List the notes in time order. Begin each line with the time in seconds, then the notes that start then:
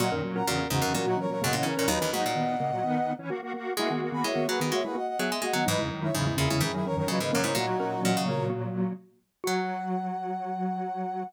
0.00 A#2 F#3 A#3 F#4 D#5 F#5
0.12 F#2 D#3 C#4 A#4
0.24 A#2 F#3
0.35 C#4 A#4 F#5 A#5
0.46 E2 A#2 C#3 A#3 F#4 A#4
0.58 C#4 A#4
0.70 E2 G#2 C#3 E3 C#4 D#4 F#4
0.82 E2 F#2 C#3 C#4 A#4
0.94 A#2 E3 F#3 C#4 F#4 A#4
1.06 A#3 D#4 F#4
1.17 E3 C#4 A#4 C#5
1.30 A#2 F#3 A#4 C#5
1.41 F#2 B2 C#3 G#3 A#3 D#5 F#5
1.53 A#2 E3 C#4 D#5 F#5
1.63 C#3 E3 C#4 A#4 C#5
1.77 A#2 C#4 A#4 C#5
1.88 D#2 F#3 D#4 B4 D#5
2.00 D#2 E3 C#4 D#4 B4
2.12 G#2 F#3 A#3 D#4 F#4 D#5 F#5
2.26 A#2
2.35 D#3 B3
2.60 C#3 A#3
2.72 A#2 F#3
2.83 D#3 B3
3.19 E3 C#4
3.30 A#3 F#4
3.43 A#3 F#4
3.54 A#3 F#4
3.77 G#3 A#3 E4 F#4 E5 G#5
3.90 D#3 A#3 B3 F#4
4.02 A#3 F#4
4.12 D#3 B3 G#5 B5
4.24 G#3 E4 C#5 E5
4.35 D#3 B3
4.48 F#3 A#3 F#4 G#4 B4
4.60 D#3 B3
4.72 G#3 A#3 F#4 C#5 E5
4.84 G#3 E4 G#4 B4
4.95 A#3 F#4 D#5 F#5
5.07 D#5 F#5
5.19 F#3 B3 G#4 E5 G#5
5.30 G#3 E5 G#5
5.42 G#3 A#3 F#4 D#5 F#5
5.53 D#3 F#3 B3 D#5 F#5
5.66 G#2 E3 F#3 D#4 B4 D#5
5.78 E2 C#3 G#3 E4
5.90 F#2 D#3
6.03 G#3 E4 C#5 E5
6.14 E2 G#2 C#3 F#3 D#4 E4 G#4
6.27 G#3 E4
6.36 E2 A#2 C#3 E3 C#4 E4 G#4
6.50 E2 C#3 G#3 E4
6.60 F#2 G#2 D#3 E3 C#4 E4 G#4
6.74 F#3 D#4 E4 G#4
6.86 E3 C#4 A#4 C#5
6.96 F#2 D#3 A#4 C#5
7.07 A#2 C#3 E3 F#3 C#4 B4 D#5
7.20 G#2 C#3 A#3 B4 D#5
7.32 F#2 C#3 E3 A#3 C#4 A#4 C#5
7.44 G#2 G#3 E4 A#4 C#5
7.55 A#2 F#3 A#3 D#4 F#4
7.80 C#4 A#4
8.03 A#2 E3 C#4 D#5 F#5
8.17 C#3
8.26 C#3 A#3 A#4 C#5
8.37 C#3 A#3
8.50 A#3 F#4
9.44 F#3 F#4 F#5